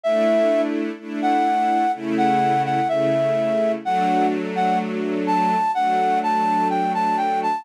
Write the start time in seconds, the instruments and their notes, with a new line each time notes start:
0.04 string ensemble 1 A3 D4 E4, flute E5
0.99 string ensemble 1 A3 D4 E4
1.22 flute F#5
1.94 string ensemble 1 C#3 A3 E4
2.18 flute F#5
2.65 flute F#5
2.88 string ensemble 1 C#3 A3 E4, flute E5
3.84 string ensemble 1 F#3 A3 D4, flute F#5
4.56 flute F#5
5.27 flute A5
5.75 string ensemble 1 F#3 A3 D4, flute F#5
6.23 flute A5
6.70 flute G5
6.94 flute A5
7.17 flute G5
7.43 flute A5